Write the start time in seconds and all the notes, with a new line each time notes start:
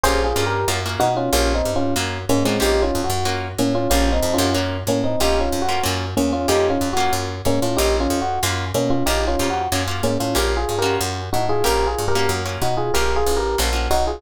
0.03 A#1 A#3 C#4 F4 G4 G#4 C5
0.24 F4 G#4
0.36 G2 A#3 C#4 F4 G4
0.46 G4 A#4
0.68 F#2 A#3 C#4 F4 F#4
0.86 A#3 C#4 F4 F#4
1.00 B2 D#4 F#4
1.17 C#4 F4
1.33 A#1 A#3 C#4 F4 G4
1.54 C4 D#4
1.65 G2
1.76 C#4 F4
1.96 F#2 A#3 C#4 F4 F#4
2.29 G#2 A#3 C#4
2.45 A2 G#3 A#3 C4 C#4 F4 F#4
2.60 A#1 A#3 C#4 D#4 F4 G4
2.82 C#4 F4
2.95 F2
3.04 F#4
3.10 F#2
3.25 A#3 C#4 F4 F#4
3.58 A2 A#3 C#4
3.75 C#4 F4
3.90 A#1 A#3 C#4 F4 G4
4.12 C4 D#4
4.23 F2
4.34 C#4 F4
4.38 F#2 A#3 C#4 F4 G4
4.55 A#3 C#4 F4 F#4
4.87 A2 A#3 C#4
5.04 C4 D#4
5.20 A#1 A#3 C#4 D#4 F4 G4
5.40 C#4 F4
5.52 F2
5.62 F#4
5.69 A#3 C#4 F4 G4
5.83 F#2 A#3 C#4 F4 F#4
6.17 E2 A#3 C#4
6.33 C#4 F4
6.48 F2 A#3 C#4 D#4 F4 G4
6.70 C#4 F4
6.81 F2
6.93 A#3 C#4 F4 F#4
7.13 F#2
7.45 G#2 A#3 C#4
7.62 A2 C#4 F4
7.77 A#1 A#3 C#4 D#4 F4 G4
8.00 C#4 F4
8.10 F2
8.21 F#4
8.43 F#2 A#3 C#4 F4 F#4
8.74 B2 A#3 C#4
8.90 C#4 F4
9.06 A#1 A#3 C#4 D#4 F4 G4
9.28 C#4 F4
9.39 F2 A#3 C#4 F4 G4
9.50 F#4
9.72 F#2 A#3 C#4 F4 F#4
9.88 A#3 C#4 F4 F#4
10.03 G#2 A#3 C#4
10.20 A2 C#4 F4
10.35 A#1 A#3 C#4 F4 G4 A#4
10.57 F4 G#4
10.69 G2
10.79 A#3 C#4 F4 F#4 G4 A#4
11.01 F#2
11.33 A2 D#4 F#4
11.49 F4 G#4
11.64 A#1 A#3 C#4 F4 G4 A#4
11.87 F4 G#4
11.98 G2
12.08 G4 A#4
12.15 A#3 C#4 F4 F#4
12.29 F#2
12.45 A#3 C#4 F4 F#4
12.62 B2 D#4 F#4
12.77 F4 G#4
12.94 A#1 A#3 C#4 F4 G4 A#4
13.16 F4 G#4
13.26 A1
13.37 G4 A#4
13.58 A#1 A#3 C#4 F4 F#4
13.73 A#3 C#4 F4 F#4
13.91 B1 D#4 F#4
14.07 F4 G#4